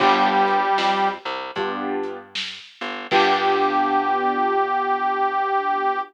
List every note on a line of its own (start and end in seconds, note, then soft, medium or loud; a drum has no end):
0.00 0.69 G1 medium
0.00 1.08 G3 loud
0.00 0.59 B3 medium
0.00 0.59 D4 loud
0.00 0.59 F4 loud
0.00 0.59 G4 loud
0.00 1.08 G4 loud
0.00 kick loud
0.00 crash loud
0.47 closed hi-hat medium
0.78 1.18 F2 medium
0.78 snare medium
1.25 1.51 C2 medium
1.56 2.60 G2 medium
1.56 2.17 B3 medium
1.56 2.17 D4 medium
1.56 2.17 F4 medium
1.56 2.17 G4 medium
1.56 kick medium
1.56 closed hi-hat medium
2.03 closed hi-hat medium
2.35 snare loud
2.81 3.07 G1 medium
2.81 closed hi-hat medium
3.11 5.99 G2 medium
3.11 6.00 B3 loud
3.11 6.00 D4 loud
3.11 6.00 F4 medium
3.11 5.99 G4 loud
3.11 6.00 G4 loud
3.11 kick loud
3.11 crash loud